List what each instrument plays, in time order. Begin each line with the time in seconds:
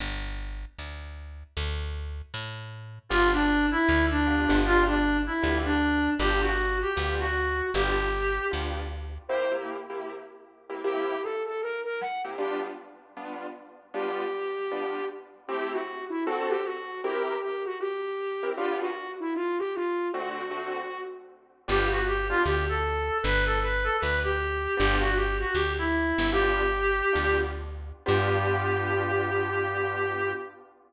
0.00 electric bass (finger) G1
0.79 electric bass (finger) D2
1.57 electric bass (finger) D2
2.34 electric bass (finger) A2
3.09 electric bass (finger) G1, acoustic grand piano B3 D4 F4 G4, clarinet F4
3.32 clarinet D4
3.71 clarinet E4
3.88 electric bass (finger) D2
4.10 clarinet D4
4.26 acoustic grand piano B3 D4 F4 G4
4.49 electric bass (finger) G1, acoustic grand piano B3 D4 F4 G4
4.65 clarinet F4
4.87 clarinet D4
5.26 clarinet E4
5.42 electric bass (finger) D2, acoustic grand piano B3 D4 F4 G4
5.65 clarinet D4
6.19 electric bass (finger) G1, acoustic grand piano B3 D4 F4 G4, clarinet G4
6.42 clarinet F#4
6.82 clarinet G4
6.96 electric bass (finger) D2, acoustic grand piano B3 D4 F4 G4
7.20 clarinet F#4
7.74 electric bass (finger) G1, acoustic grand piano B3 D4 F4 G4, clarinet G4
8.51 electric bass (finger) D2, acoustic grand piano B3 D4 F4 G4
9.29 acoustic grand piano C3 A#3 E4 G4, flute C5
9.51 acoustic grand piano C3 A#3 E4 G4
9.90 acoustic grand piano C3 A#3 E4 G4
10.69 acoustic grand piano C3 A#3 E4 G4
10.84 acoustic grand piano C3 A#3 E4 G4, flute G4
11.23 flute A4
11.46 flute A4
11.61 flute A#4
11.84 flute A#4
12.01 flute F#5
12.24 acoustic grand piano C3 A#3 E4 G4
12.38 acoustic grand piano G3 B3 D4 F4, flute G4
13.17 acoustic grand piano G3 B3 D4 F4
13.94 acoustic grand piano G3 B3 D4 F4, flute G4
14.71 acoustic grand piano G3 B3 D4 F4
15.48 acoustic grand piano A3 C4 E4 G4, flute G4
15.72 flute F#4
16.10 flute E4
16.25 acoustic grand piano D3 C4 F#4 A4, flute F#4
16.49 flute G4
16.64 flute F#4
17.03 acoustic grand piano C4 E4 G4 A#4, flute G4
17.42 flute G4
17.65 flute F#4
17.80 flute G4
18.43 acoustic grand piano C4 E4 G4 A#4
18.57 acoustic grand piano G3 B3 D4 F4, flute G4
18.81 flute F#4
19.20 flute E4
19.35 flute F4
19.59 flute G4
19.75 flute F4
20.13 acoustic grand piano D3 A3 C4 F#4, flute F#4
20.51 acoustic grand piano D3 A3 C4 F#4
21.68 electric bass (finger) G1, acoustic grand piano B3 D4 F4 G4, clarinet G4
21.91 clarinet F#4
22.07 clarinet G4
22.29 acoustic grand piano B3 D4 F4 G4, clarinet F4
22.45 electric bass (finger) D2, clarinet G4
22.69 clarinet A4
23.23 electric bass (finger) G1, clarinet B4
23.46 clarinet A4
23.62 clarinet B4
23.84 clarinet A4
24.00 electric bass (finger) D2, clarinet B4
24.23 clarinet G4
24.77 electric bass (finger) G1, acoustic grand piano B3 D4 F4 G4, clarinet G4
25.00 clarinet F#4
25.16 clarinet G4
25.40 clarinet F#4
25.54 electric bass (finger) D2, clarinet G4
25.78 clarinet E4
26.18 electric bass (finger) G1
26.32 acoustic grand piano B3 D4 F4 G4, clarinet G4
27.13 electric bass (finger) D2, acoustic grand piano B3 D4 F4 G4
28.06 electric bass (finger) G2, acoustic grand piano B3 D4 F4 G4, clarinet G4